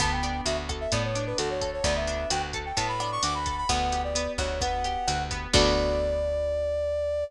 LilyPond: <<
  \new Staff \with { instrumentName = "Brass Section" } { \time 4/4 \key d \major \tempo 4 = 130 a''16 g''8. e''16 r8 e''16 d''16 cis''8 b'16 a'16 cis''8 cis''16 | d''16 e''8. g''16 r8 g''16 a''16 b''8 cis'''16 d'''16 b''8 b''16 | fis''8. d''8. cis''8 fis''4. r8 | d''1 | }
  \new Staff \with { instrumentName = "Acoustic Guitar (steel)" } { \time 4/4 \key d \major b8 d'8 fis'8 a'8 b8 d'8 fis'8 a'8 | b8 d'8 fis'8 a'8 b8 d'8 fis'8 a'8 | b8 g'8 b8 fis'8 b8 g'8 fis'8 b8 | <b d' fis' a'>1 | }
  \new Staff \with { instrumentName = "Electric Bass (finger)" } { \clef bass \time 4/4 \key d \major d,4 d,4 a,4 d,4 | d,4 d,4 a,4 d,4 | d,4. d,4. d,4 | d,1 | }
  \new DrumStaff \with { instrumentName = "Drums" } \drummode { \time 4/4 <hh bd ss>8 hh8 hh8 <hh bd ss>8 <hh bd>8 hh8 <hh ss>8 <hh bd>8 | <hh bd>8 hh8 <hh ss>8 <hh bd>8 <hh bd>8 <hh ss>8 hh8 <hh bd>8 | <hh bd ss>8 hh8 hh8 <hh bd ss>8 <hh bd>8 hh8 <hh ss>8 <hh bd>8 | <cymc bd>4 r4 r4 r4 | }
>>